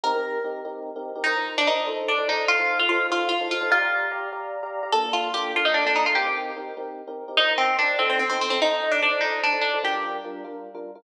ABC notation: X:1
M:6/8
L:1/16
Q:3/8=98
K:Bb
V:1 name="Acoustic Guitar (steel)"
B6 z6 | E3 D E2 z2 D2 E2 | F3 F F2 F2 F2 F2 | F4 z8 |
A2 F2 G2 F E D D E F | G4 z8 | E2 C2 D2 C C C C C C | E3 D D2 E2 D2 D2 |
G4 z8 |]
V:2 name="Electric Piano 1"
[CEGB] [CEGB]3 [CEGB]2 [CEGB]3 [CEGB]2 [CEGB] | [F,EBc] [F,EBc]3 [F,EBc]2 [F,EAc]3 [F,EAc] [F,EAc]2- | [F,EAc] [F,EAc]3 [F,EAc]2 [F,EAc]3 [F,EAc]2 [F,EAc] | [Gdfb] [Gdfb]3 [Gdfb]2 [Gdfb]3 [Gdfb]2 [Gdfb] |
[B,DFA] [B,DFA]3 [B,DFA]2 [B,DFA]3 [B,DFA]2 [B,DFA] | [CEGB] [CEGB]3 [CEGB]2 [CEGB]3 [CEGB]2 [CEGB] | [F,EBc] [F,EBc]3 [F,EBc]2 [F,EAc]3 [F,EAc]2 [F,EAc] | [F,EAc] [F,EAc]3 [F,EAc]2 [F,EAc]3 [F,EAc]2 [F,EAc] |
[G,DFB] [G,DFB]3 [G,DFB]2 [G,DFB]3 [G,DFB]2 [G,DFB] |]